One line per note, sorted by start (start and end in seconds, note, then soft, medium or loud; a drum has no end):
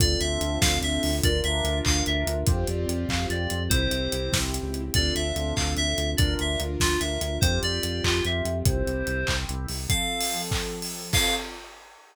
0.00 0.17 D2 medium
0.00 1.10 C4 loud
0.00 1.22 C4 loud
0.00 1.10 D4 medium
0.00 1.22 D4 medium
0.00 1.10 F4 loud
0.00 1.22 F4 medium
0.00 1.10 A4 loud
0.00 1.22 A4 medium
0.00 0.20 D5 medium
0.00 kick loud
0.00 closed hi-hat loud
0.20 0.38 D2 medium
0.20 0.59 E5 medium
0.20 closed hi-hat medium
0.41 0.59 D2 medium
0.41 closed hi-hat medium
0.61 0.79 D2 medium
0.61 0.79 F5 medium
0.61 kick loud
0.61 snare loud
0.81 0.99 D2 medium
0.81 1.16 E5 medium
0.81 closed hi-hat medium
1.03 1.21 D2 medium
1.03 open hi-hat medium
1.23 1.42 D2 medium
1.23 2.46 D4 medium
1.23 2.35 D4 loud
1.23 2.46 F4 medium
1.23 2.35 F4 loud
1.23 2.46 A#4 medium
1.23 2.35 A#4 loud
1.23 1.40 D5 medium
1.23 kick loud
1.23 closed hi-hat loud
1.44 1.62 D2 medium
1.44 1.79 E5 medium
1.44 closed hi-hat medium
1.64 1.82 D2 medium
1.64 closed hi-hat medium
1.85 2.03 D2 medium
1.85 2.04 F5 medium
1.85 kick medium
1.85 clap loud
2.06 2.25 D2 medium
2.06 2.44 E5 medium
2.06 closed hi-hat medium
2.27 2.44 D2 medium
2.27 closed hi-hat medium
2.47 2.65 F2 medium
2.47 3.70 C4 loud
2.47 3.59 C4 loud
2.47 3.70 F4 medium
2.47 3.59 F4 medium
2.47 3.70 G4 medium
2.47 3.59 G4 medium
2.47 2.67 C5 medium
2.47 kick loud
2.47 closed hi-hat loud
2.67 2.86 F2 medium
2.67 3.09 D5 medium
2.67 closed hi-hat medium
2.88 3.06 F2 medium
2.88 closed hi-hat medium
3.08 3.26 F2 medium
3.08 3.27 F5 medium
3.08 kick medium
3.08 clap loud
3.30 3.47 F2 medium
3.30 3.63 D5 medium
3.30 closed hi-hat medium
3.50 3.69 F2 medium
3.50 closed hi-hat medium
3.70 3.88 C2 medium
3.70 4.82 C4 loud
3.70 4.94 C4 loud
3.70 4.82 E4 loud
3.70 4.94 E4 medium
3.70 4.82 G4 loud
3.70 4.94 G4 medium
3.70 4.38 C5 medium
3.70 kick loud
3.70 closed hi-hat loud
3.91 4.08 C2 medium
3.91 closed hi-hat medium
4.12 4.30 C2 medium
4.12 closed hi-hat medium
4.32 4.60 C2 medium
4.32 kick medium
4.32 snare loud
4.54 closed hi-hat medium
4.63 4.91 C#2 medium
4.74 closed hi-hat medium
4.94 5.12 D2 medium
4.94 6.17 C4 medium
4.94 6.07 C4 medium
4.94 6.17 D4 medium
4.94 6.07 D4 loud
4.94 6.17 F4 medium
4.94 6.07 F4 medium
4.94 6.17 A4 medium
4.94 6.07 A4 medium
4.94 5.14 D5 medium
4.94 kick loud
4.94 closed hi-hat loud
5.15 5.33 D2 medium
5.15 5.54 E5 medium
5.15 closed hi-hat medium
5.36 5.53 D2 medium
5.36 closed hi-hat medium
5.56 5.75 D2 medium
5.56 5.73 F5 medium
5.56 kick medium
5.56 clap loud
5.77 5.95 D2 medium
5.77 6.11 E5 medium
5.77 closed hi-hat medium
5.98 6.16 D2 medium
5.98 closed hi-hat medium
6.17 6.36 D2 medium
6.17 7.41 D4 medium
6.17 7.31 D4 loud
6.17 7.41 F4 loud
6.17 7.31 F4 medium
6.17 7.41 A#4 medium
6.17 7.31 A#4 medium
6.17 6.34 D5 medium
6.17 kick loud
6.17 closed hi-hat loud
6.39 6.57 D2 medium
6.39 6.61 E5 medium
6.39 closed hi-hat medium
6.60 6.77 D2 medium
6.60 closed hi-hat medium
6.80 6.98 D2 medium
6.80 6.99 F4 medium
6.80 kick medium
6.80 snare loud
7.00 7.18 D2 medium
7.00 7.38 E5 medium
7.00 closed hi-hat medium
7.21 7.39 D2 medium
7.21 closed hi-hat medium
7.41 7.59 F2 medium
7.41 8.65 C4 medium
7.41 8.54 C4 medium
7.41 8.65 F4 medium
7.41 8.54 F4 medium
7.41 8.65 G4 medium
7.41 8.54 G4 medium
7.41 7.60 C5 medium
7.41 kick loud
7.41 closed hi-hat loud
7.62 7.80 F2 medium
7.62 8.04 D5 medium
7.62 closed hi-hat medium
7.83 8.01 F2 medium
7.83 closed hi-hat medium
8.04 8.21 F2 medium
8.04 8.24 F4 medium
8.04 kick medium
8.04 clap loud
8.25 8.42 F2 medium
8.25 8.59 E5 medium
8.25 closed hi-hat medium
8.45 8.63 F2 medium
8.45 closed hi-hat medium
8.65 8.83 C2 medium
8.65 9.77 C4 loud
8.65 9.77 E4 medium
8.65 9.77 G4 medium
8.65 9.35 C5 medium
8.65 kick loud
8.65 closed hi-hat loud
8.86 9.04 C2 medium
8.86 closed hi-hat medium
9.07 9.25 C2 medium
9.07 closed hi-hat medium
9.27 9.46 C2 medium
9.27 kick medium
9.27 clap loud
9.49 9.67 C2 medium
9.49 closed hi-hat medium
9.68 9.87 C2 medium
9.68 open hi-hat medium
9.89 11.00 F3 medium
9.89 11.12 F3 medium
9.89 11.00 C4 medium
9.89 11.12 C4 medium
9.89 11.00 A4 medium
9.89 11.12 A4 medium
9.89 10.42 F5 medium
9.89 kick loud
9.89 closed hi-hat loud
10.21 open hi-hat loud
10.51 kick loud
10.51 clap loud
10.82 open hi-hat medium
11.13 11.35 C4 medium
11.13 11.35 F4 loud
11.13 11.35 F4 medium
11.13 11.35 A4 loud
11.13 11.35 A4 medium
11.13 11.35 F5 loud
11.13 kick loud
11.13 crash loud